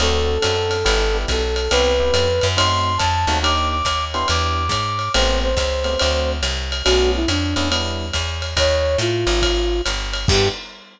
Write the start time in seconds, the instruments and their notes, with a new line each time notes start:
0.00 electric bass (finger) D2, electric piano 1 C4 D4 F#4 A4, flute A4, ride
0.42 electric bass (finger) F#2, electric piano 1 C4 D4 F#4 A4, hi-hat pedal, ride
0.71 ride
0.85 electric bass (finger) G1, electric piano 1 B3 D4 E4 G4, kick, ride
1.14 electric piano 1 B3 D4 E4 G4
1.28 electric bass (finger) B1, flute A4, kick, hi-hat pedal, ride
1.56 ride
1.71 electric bass (finger) C2, electric piano 1 B3 C4 E4 G4, flute B4, ride
2.00 electric piano 1 B3 C4 E4 G4
2.14 electric bass (finger) F2, hi-hat pedal, ride
2.41 electric bass (finger) F#2, ride
2.57 electric piano 1 A3 C4 D#4 F#4, flute C6, kick, ride
2.98 electric bass (finger) F2, flute A5, kick, hi-hat pedal, ride
3.27 electric bass (finger) D#2, electric piano 1 A3 C4 D#4 F#4, ride
3.43 electric piano 1 A#3 D4 D#4 G4, flute D6, ride
3.70 flute D6
3.85 electric bass (finger) D#2, kick, hi-hat pedal, ride
4.13 electric piano 1 B3 D4 E4 G4, flute C6, ride
4.28 electric bass (finger) E2, flute D6, ride
4.69 electric bass (finger) G#2, kick, hi-hat pedal, ride
4.99 ride
5.14 electric bass (finger) A1, electric piano 1 A3 B3 C4 G4, flute C5, ride
5.43 flute C5
5.57 electric bass (finger) C#2, kick, hi-hat pedal, ride
5.84 electric piano 1 A3 B3 C4 G4, ride
5.99 electric bass (finger) D2, electric piano 1 A3 C4 D4 F#4, ride
6.43 electric bass (finger) C2, hi-hat pedal, ride
6.72 ride
6.85 electric bass (finger) B1, electric piano 1 A3 B3 C#4 D4, flute F#4, ride
7.16 flute E4
7.28 electric bass (finger) F2, flute D4, hi-hat pedal, ride
7.56 electric bass (finger) E2, electric piano 1 A3 B3 C#4 D4, ride
7.71 electric piano 1 G3 B3 D4 E4, ride
8.13 electric bass (finger) E2, kick, hi-hat pedal, ride
8.42 ride
8.57 electric bass (finger) D#2, flute C#5, kick, ride
8.98 electric bass (finger) A2, flute F4, hi-hat pedal, ride
9.27 electric bass (finger) G#1, ride
9.42 kick, ride
9.86 electric bass (finger) G1, hi-hat pedal, ride
10.13 ride
10.28 electric bass (finger) G2, electric piano 1 B3 D4 E4 G4, flute G4, kick, crash